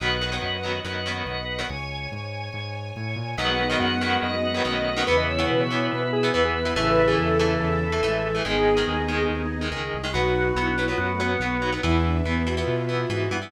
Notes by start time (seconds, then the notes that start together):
0.00 B1 D#3 F#3 B3 B4 D#5 F#5
0.21 D#3 F#3 B3
0.32 D#3 F#3 B3
0.41 F#2 B4 D#5 F#5
0.63 D#3 F#3 B3
0.84 F#2 D#3 F#3 B3 B4 D#5 F#5
1.06 D#3 F#3 B3
1.26 B1 B4 D#5 F#5
1.59 D#3 F#3 B3
1.69 C#2 C#5 G#5
2.12 G#2 C#5 G#5
2.52 G#2 C#5 G#5
2.96 A2 C#5 G#5
3.16 A#2
3.37 B1 D#3 F#3 G#3 B3 D#4 F#4 B4 D#5 F#5
3.48 F#5
3.69 D#3 F#3 B3 D#5
3.79 F#2 B4 D#5 F#5
4.01 D#3 F#3 B3
4.22 F#2 B4 D#5 F#5
4.54 D#3 F#3 B3
4.65 B1 D#3 F#3 A3 B3 C#4 B4 D#5 F#5
4.96 D#3 F#3 B3
5.06 E2 C#3 E3 B3 E4 B4 E5
5.17 D#5
5.28 C#5
5.38 E3 B3
5.48 B2 B4 E5
5.60 C#5
5.70 E3 B3
5.91 B2 B4 E5
6.02 B4
6.13 G#4
6.23 E3 B3
6.34 E2 E3 B3 B4 E5
6.45 G#4
6.55 B4
6.65 E3 B3
6.75 A1 C#3 E3 A3 E4 A4 E5
6.87 B4
7.08 E3 A3 G#4
7.17 E2 A4
7.39 E3 A3
7.60 E2 A4
7.92 E3 A3
8.02 A1 E3 G#3 A3
8.35 E3 A3
8.44 G#1 D#3 G#3 B3 D#4 G#4 D#5
8.54 B3 D#4
8.77 D#3 G#3
8.87 D#2
9.08 D#3 G#3
9.29 D#2
9.61 D#3 G#3
9.71 C#2 D#3 G#3
9.94 C2
10.04 D#3 G#3
10.13 B1 F#3 B3 D#4 F#4 B4 F#5
10.56 B1 F#3 B3 E4
10.68 D4
10.77 F#3 B3 E4
10.87 F#3 B3 F4
10.98 F#2 B3 F#4
11.10 A3
11.19 F#3 B3
11.30 B3
11.40 B1 F#3 B3
11.61 F#3 B3 D#4
11.72 F#3 B3
11.83 E2 E3 B3 E4 B4 E5
11.94 E4
12.05 D4
12.25 E2 E3 B3
12.45 E3 B3 F#4
12.57 E3 B3 F4
12.67 B2
12.89 E3 B3 F4
13.00 F4
13.09 G#2 E3 B3 F#4
13.31 G2 E3 B3
13.42 E3 B3